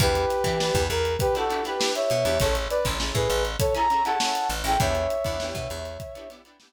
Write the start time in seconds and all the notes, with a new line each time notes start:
0.00 E2 D4 E4 G4 B4, kick, closed hi-hat
0.15 closed hi-hat
0.30 snare, closed hi-hat
0.44 E3 D4 E4 G4, kick, closed hi-hat
0.48 B4
0.60 D4 E4 G4 B4, snare
0.75 E2, kick, closed hi-hat
0.90 E2 A#4, closed hi-hat
1.05 closed hi-hat
1.19 G4 B4, kick, closed hi-hat
1.35 D4 E4 F#4 G4 A4 B4, snare, closed hi-hat
1.50 D4 E4 G4 B4, closed hi-hat
1.64 D4 E4 G4 B4, snare, closed hi-hat
1.79 D4 E4 G4 B4, snare
1.95 C#5 E5, closed hi-hat
2.10 B2, closed hi-hat
2.25 E2 D4 E4 G4 B4, closed hi-hat
2.40 A1 C#4 E4 G#4 A4 C#5, kick, closed hi-hat
2.55 closed hi-hat
2.70 B4 D5, snare, closed hi-hat
2.85 A1 C#4 E4 G#4 A4, kick, closed hi-hat
3.00 C#4 E4 G#4 A4, snare
3.15 A2 G#4 B4, kick, closed hi-hat
3.29 A1, closed hi-hat
3.45 closed hi-hat
3.59 A4 C#5, kick, closed hi-hat
3.75 C#4 E4 G#4 A4 A#5, snare, closed hi-hat
3.90 C#4 E4 G#4 A4, closed hi-hat
4.05 C#4 E4 G#4 A4 F#5 A5, closed hi-hat
4.20 C#4 E4 G#4 A4, snare
4.35 closed hi-hat
4.50 A1, closed hi-hat
4.64 A1 C#4 E4 G#4 G5, closed hi-hat
4.68 A4
4.80 E2 B3 D4 E4 G4 C#5 E5, kick, closed hi-hat
4.95 closed hi-hat
5.10 closed hi-hat
5.24 E2 B3 D4 E4 G4, kick, closed hi-hat
5.40 B3 D4 E4 G4, snare
5.55 B2, kick, closed hi-hat
5.70 E2, closed hi-hat
5.85 snare, closed hi-hat
6.00 kick, closed hi-hat
6.15 B3 D4 E4 G4, closed hi-hat
6.30 B3 D4 E4 G4, snare, closed hi-hat
6.45 B3 D4 E4 G4, closed hi-hat
6.60 B3 D4 E4 G4, snare